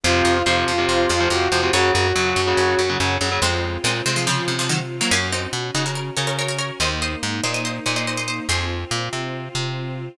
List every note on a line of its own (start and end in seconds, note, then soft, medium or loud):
0.04 0.22 F2 medium
0.04 0.38 C3 loud
0.04 0.38 F3 medium
0.04 0.42 F4 medium
0.04 1.72 C5 medium
0.04 0.25 C5 medium
0.04 1.72 F5 medium
0.25 0.43 F2 medium
0.25 0.44 D#5 medium
0.46 0.64 F2 medium
0.46 0.72 C3 medium
0.46 0.72 F3 medium
0.46 1.27 F4 medium
0.46 0.87 C5 medium
0.68 0.86 F2 medium
0.78 1.12 C3 medium
0.78 1.12 F3 medium
0.89 1.07 F2 medium
1.09 1.28 F2 medium
1.09 1.44 G#4 medium
1.20 1.29 C3 medium
1.20 1.29 F3 medium
1.30 1.48 F2 medium
1.30 1.48 C3 medium
1.30 1.48 F3 medium
1.30 1.71 F#4 medium
1.52 1.70 F2 medium
1.52 1.61 C3 medium
1.52 1.61 F3 medium
1.52 1.72 C5 medium
1.63 1.71 C3 medium
1.63 1.71 F3 medium
1.73 1.91 F#2 medium
1.73 2.07 C#3 medium
1.73 2.07 F#3 medium
1.73 1.92 F#4 medium
1.73 2.32 C#5 medium
1.73 3.41 C#5 medium
1.73 3.41 F#5 medium
1.94 2.13 F#2 medium
1.94 2.89 F#4 medium
2.15 2.34 F#2 medium
2.15 2.41 C#3 medium
2.15 2.41 F#3 medium
2.36 2.54 F#2 medium
2.47 2.81 C#3 medium
2.47 2.81 F#3 medium
2.57 2.75 F#2 medium
2.79 2.97 F#2 medium
2.89 2.98 C#3 medium
2.89 2.98 F#3 medium
3.00 3.18 F#2 medium
3.00 3.17 C#3 medium
3.00 3.17 F#3 medium
3.21 3.39 F#2 medium
3.21 3.30 C#3 medium
3.21 3.30 F#3 medium
3.32 3.40 C#3 medium
3.32 3.40 F#3 medium
3.42 3.78 F2 medium
3.42 3.77 G#3 medium
3.42 5.09 C4 medium
3.42 3.77 C4 medium
3.42 5.09 F4 medium
3.84 4.02 A#2 medium
3.84 4.02 G#3 medium
3.84 4.02 C4 medium
4.06 4.42 C3 medium
4.06 4.15 G#3 medium
4.06 4.16 C4 medium
4.16 4.26 F3 medium
4.16 4.26 G#3 medium
4.27 4.56 C#3 medium
4.27 4.56 F3 medium
4.48 5.02 C3 medium
4.59 4.69 C#3 medium
4.59 4.69 F3 medium
4.69 4.79 D#3 medium
4.69 4.79 F#3 medium
5.01 5.11 F#3 medium
5.01 5.11 A#3 medium
5.11 5.47 F#2 medium
5.11 5.29 A#3 medium
5.11 5.29 C#4 loud
5.11 6.79 C#4 medium
5.11 6.79 F#4 medium
5.32 5.51 C4 medium
5.32 5.51 D#4 medium
5.53 5.71 B2 medium
5.75 6.10 C#3 medium
5.75 5.85 D#4 medium
5.75 5.85 F#4 medium
5.86 5.96 F#4 medium
5.86 5.95 A#4 medium
5.95 6.14 A#4 medium
5.95 6.14 C#5 medium
6.17 6.71 C#3 medium
6.17 6.27 A#4 medium
6.17 6.27 C#5 medium
6.27 6.37 A#4 medium
6.27 6.37 C#5 medium
6.39 6.48 A#4 medium
6.39 6.48 C#5 medium
6.48 6.58 A#4 medium
6.48 6.58 C#5 medium
6.59 6.77 A#4 medium
6.59 6.77 C#5 medium
6.80 7.16 D#2 medium
6.80 8.47 A#3 medium
6.80 8.47 D#4 medium
6.80 7.00 C5 medium
6.80 7.00 D#5 medium
7.02 7.21 C5 medium
7.02 7.21 D#5 medium
7.23 7.41 G#2 medium
7.43 7.80 A#2 medium
7.43 7.54 C5 medium
7.43 7.54 D#5 medium
7.54 7.64 C5 medium
7.54 7.64 D#5 medium
7.65 7.84 C5 medium
7.65 7.84 D#5 medium
7.86 8.40 A#2 medium
7.86 7.96 C5 medium
7.86 7.96 D#5 medium
7.96 8.06 C5 medium
7.96 8.06 D#5 medium
8.07 8.17 C5 medium
8.07 8.17 D#5 medium
8.17 8.27 C5 medium
8.17 8.27 D#5 medium
8.28 8.46 C5 medium
8.28 8.46 D#5 medium
8.49 8.85 F2 medium
8.49 10.16 C4 medium
8.49 10.16 F4 medium
8.49 8.85 G#4 medium
8.49 8.85 C5 medium
8.91 9.09 A#2 medium
9.13 9.49 C3 medium
9.55 10.09 C3 medium